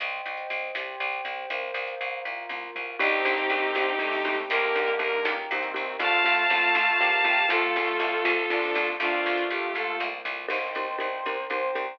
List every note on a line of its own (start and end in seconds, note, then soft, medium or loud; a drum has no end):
0.00 0.22 C2 loud
0.00 0.74 C5 medium
0.00 0.74 D#5 medium
0.00 0.74 G5 medium
0.00 kick loud
0.00 closed hi-hat loud
0.26 0.47 C2 medium
0.37 closed hi-hat medium
0.50 0.71 C2 medium
0.75 0.96 C2 medium
0.75 1.49 G4 medium
0.75 1.49 C5 medium
0.75 1.49 G5 medium
0.75 snare loud
1.00 1.21 C2 medium
1.12 closed hi-hat medium
1.25 1.46 C2 medium
1.50 1.71 C2 medium
1.50 2.24 A#4 medium
1.50 2.24 C5 medium
1.50 2.24 F5 medium
1.50 kick loud
1.50 closed hi-hat medium
1.74 1.96 C2 medium
1.87 closed hi-hat medium
2.01 2.22 C2 medium
2.25 2.46 C2 medium
2.25 2.99 F4 medium
2.25 2.99 A#4 medium
2.25 2.99 F5 medium
2.25 kick medium
2.49 2.71 C2 medium
2.49 high tom medium
2.75 2.97 C2 medium
2.75 mid tom medium
2.99 3.21 C2 loud
2.99 3.92 D#3 medium
2.99 3.09 C4 medium
2.99 3.92 C4 medium
2.99 3.74 C4 medium
2.99 3.09 D4 medium
2.99 3.74 D4 medium
2.99 3.09 D#4 medium
2.99 3.74 D#4 medium
2.99 4.35 D#4 medium
2.99 3.09 G4 loud
2.99 3.74 G4 medium
2.99 4.35 G4 medium
2.99 kick loud
2.99 crash loud
3.25 3.46 C2 loud
3.25 3.35 C4 medium
3.25 3.35 D4 medium
3.25 3.35 D#4 medium
3.25 3.35 G4 medium
3.37 closed hi-hat medium
3.50 3.71 C2 loud
3.50 3.62 C4 medium
3.50 3.62 D4 medium
3.50 3.62 D#4 medium
3.50 3.62 G4 medium
3.75 3.96 C2 medium
3.75 4.49 G3 medium
3.75 4.49 C4 medium
3.75 3.86 C4 medium
3.75 4.49 D4 medium
3.75 3.86 D4 medium
3.75 3.86 D#4 medium
3.75 4.49 G4 medium
3.75 3.86 G4 medium
3.75 snare medium
3.99 4.21 C2 medium
3.99 4.42 C3 medium
3.99 4.42 A3 medium
3.99 4.09 C4 medium
3.99 4.09 D4 medium
3.99 4.09 D#4 medium
3.99 4.09 G4 medium
4.12 open hi-hat medium
4.25 4.46 C2 medium
4.25 4.60 A#3 loud
4.25 4.60 D#4 medium
4.25 4.60 G4 loud
4.49 4.72 C2 loud
4.49 5.37 D3 medium
4.49 5.24 A#3 medium
4.49 5.37 A#3 loud
4.49 5.24 D#4 medium
4.49 4.90 G4 medium
4.49 5.24 G4 medium
4.49 4.90 A#4 medium
4.49 kick loud
4.49 closed hi-hat loud
4.75 4.97 C2 medium
4.75 4.86 A#3 medium
4.75 4.86 D#4 medium
4.75 4.86 G4 medium
4.88 closed hi-hat medium
4.99 5.20 C2 medium
4.99 5.09 A#3 medium
4.99 5.09 D#4 medium
4.99 5.09 G4 medium
4.99 5.23 A#4 medium
5.25 5.46 C#2 medium
5.25 5.99 A#3 medium
5.25 5.35 A#3 medium
5.25 5.35 D#4 medium
5.25 5.99 G4 medium
5.25 5.35 G4 medium
5.25 5.99 A#4 medium
5.25 snare loud
5.50 5.72 C2 loud
5.50 5.95 D#3 medium
5.50 5.62 A#3 medium
5.50 5.95 C4 medium
5.50 5.62 D#4 medium
5.50 5.62 G4 medium
5.63 closed hi-hat medium
5.74 5.97 C2 medium
5.74 5.84 A#3 medium
5.74 5.84 D#4 medium
5.74 5.84 G4 medium
5.99 6.21 C2 loud
5.99 6.10 A3 loud
5.99 6.74 A3 medium
5.99 6.43 A3 medium
5.99 6.10 C4 loud
5.99 6.74 C4 medium
5.99 6.10 F4 loud
5.99 6.74 F4 medium
5.99 6.43 F4 loud
5.99 7.47 F5 medium
5.99 7.47 A5 medium
5.99 kick loud
5.99 closed hi-hat loud
6.24 6.46 C2 medium
6.24 6.34 A3 medium
6.24 6.34 C4 medium
6.24 6.34 F4 medium
6.38 closed hi-hat medium
6.50 6.71 C2 medium
6.50 6.99 A3 medium
6.50 6.61 A3 medium
6.50 6.61 C4 medium
6.50 6.99 F4 loud
6.50 6.61 F4 medium
6.75 6.96 C2 medium
6.75 7.49 F3 medium
6.75 7.49 A3 medium
6.75 6.86 A3 medium
6.75 6.86 C4 medium
6.75 7.49 F4 medium
6.75 6.86 F4 medium
6.75 snare loud
6.99 7.22 C2 medium
6.99 7.10 A3 medium
6.99 7.45 A#3 medium
6.99 7.10 C4 medium
6.99 7.10 F4 medium
6.99 7.45 G4 medium
7.12 closed hi-hat medium
7.24 7.46 C2 medium
7.24 7.34 A3 medium
7.24 7.34 C4 medium
7.24 7.34 F4 medium
7.49 7.71 C2 loud
7.49 7.59 A3 loud
7.49 8.31 A3 medium
7.49 8.24 A3 medium
7.49 7.59 C4 medium
7.49 8.24 C4 medium
7.49 7.59 F4 medium
7.49 8.87 F4 medium
7.49 8.31 F4 loud
7.49 8.24 F4 medium
7.49 8.87 A4 medium
7.49 kick medium
7.49 closed hi-hat loud
7.76 7.97 C2 medium
7.76 7.87 A3 medium
7.76 7.87 C4 medium
7.76 7.87 F4 medium
7.88 closed hi-hat medium
8.00 8.21 C2 loud
8.00 8.10 A3 medium
8.00 8.10 C4 medium
8.00 8.10 F4 medium
8.25 8.46 C2 loud
8.25 8.99 F3 medium
8.25 8.35 A3 medium
8.25 8.99 A3 medium
8.25 8.35 C4 medium
8.25 8.35 F4 medium
8.25 8.99 F4 medium
8.25 snare loud
8.50 8.71 C2 medium
8.50 8.93 F3 medium
8.50 8.60 A3 medium
8.50 8.60 C4 medium
8.50 8.93 D4 medium
8.50 8.60 F4 medium
8.63 open hi-hat medium
8.75 8.97 C2 loud
8.75 8.86 A3 medium
8.75 8.86 C4 medium
8.75 8.86 F4 medium
8.99 9.21 C2 loud
8.99 10.07 A3 medium
8.99 9.74 A#3 medium
8.99 9.74 C4 medium
8.99 9.43 D4 medium
8.99 10.07 F4 medium
8.99 9.43 F4 medium
8.99 9.74 F4 medium
8.99 kick loud
8.99 closed hi-hat loud
9.26 9.47 C2 medium
9.38 closed hi-hat medium
9.50 9.72 C2 medium
9.50 9.74 G4 medium
9.75 9.97 C2 medium
9.75 10.49 F3 medium
9.75 10.49 A#3 medium
9.75 10.49 F4 medium
9.75 9.97 A4 medium
9.75 kick medium
9.75 snare medium
10.00 10.21 C2 loud
10.00 snare medium
10.25 10.46 C2 loud
10.25 floor tom loud
10.48 10.71 C2 medium
10.48 10.58 C4 medium
10.48 10.58 D#4 medium
10.48 10.58 G4 medium
10.48 10.58 A#4 medium
10.48 11.24 A#4 medium
10.48 11.44 C5 medium
10.48 11.24 C5 medium
10.48 11.24 D#5 medium
10.48 11.24 G5 medium
10.48 kick medium
10.48 crash loud
10.75 10.96 C2 medium
10.75 10.86 C4 medium
10.75 10.86 D#4 medium
10.75 10.86 G4 medium
10.75 10.86 A#4 medium
10.98 11.21 C2 medium
10.98 11.08 C4 medium
10.98 11.08 D#4 medium
10.98 11.08 G4 medium
10.98 11.08 A#4 medium
11.25 11.47 C2 medium
11.25 11.36 C4 medium
11.25 11.36 D#4 medium
11.25 11.36 G4 medium
11.25 11.99 A#4 medium
11.25 11.36 A#4 medium
11.25 11.99 C5 medium
11.25 11.99 G5 medium
11.25 11.99 A#5 medium
11.50 11.71 C2 medium
11.50 11.61 C4 medium
11.50 11.61 D#4 medium
11.50 11.61 G4 medium
11.50 11.61 A#4 medium
11.50 11.94 C5 medium
11.75 11.97 C2 medium
11.75 11.85 C4 medium
11.75 11.85 D#4 medium
11.75 11.85 G4 medium
11.75 11.85 A#4 medium